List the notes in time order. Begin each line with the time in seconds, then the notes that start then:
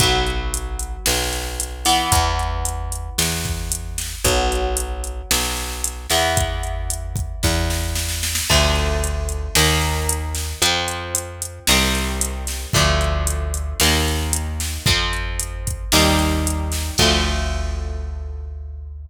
0.00 B1 F#3 B3, kick, closed hi-hat
0.27 closed hi-hat
0.54 closed hi-hat
0.79 closed hi-hat
1.06 B1, snare
1.33 closed hi-hat
1.60 closed hi-hat
1.85 E3 B3, snare, open hi-hat
2.12 E2, kick, closed hi-hat
2.39 closed hi-hat
2.65 closed hi-hat
2.92 closed hi-hat
3.18 E2, snare
3.45 kick, closed hi-hat
3.72 closed hi-hat
3.98 snare, closed hi-hat
4.24 B1 F#3 B3, kick, closed hi-hat
4.52 closed hi-hat
4.77 closed hi-hat
5.04 closed hi-hat
5.31 B1, snare
5.57 closed hi-hat
5.84 closed hi-hat
6.10 E2 E3 B3, snare, closed hi-hat
6.37 kick, closed hi-hat
6.63 closed hi-hat
6.90 closed hi-hat
7.16 kick, closed hi-hat
7.43 E2, kick, snare
7.70 snare
7.95 snare
8.09 snare
8.23 snare
8.35 snare
8.50 D2 D3 F3 A3, kick, crash
8.76 closed hi-hat
9.04 closed hi-hat
9.29 closed hi-hat
9.55 D#2 D#3 A#3, snare
9.82 closed hi-hat
10.09 closed hi-hat
10.35 snare, closed hi-hat
10.62 F2 F3 C4, closed hi-hat
10.88 closed hi-hat
11.15 closed hi-hat
11.42 closed hi-hat
11.67 C2 D#3 G3 C4, snare
11.95 closed hi-hat
12.21 closed hi-hat
12.47 snare, closed hi-hat
12.73 D2 D3 F3 A3, kick, closed hi-hat
13.01 closed hi-hat
13.27 closed hi-hat
13.54 closed hi-hat
13.80 D#2 D#3 A#3, snare
14.08 closed hi-hat
14.33 closed hi-hat
14.60 snare, closed hi-hat
14.86 F2 F3 C4, kick, closed hi-hat
15.13 closed hi-hat
15.39 closed hi-hat
15.67 kick, closed hi-hat
15.92 D#2 D#3 G3 C4, snare
16.19 closed hi-hat
16.47 closed hi-hat
16.72 snare, closed hi-hat
16.98 D2 D3 F3 A3, kick, crash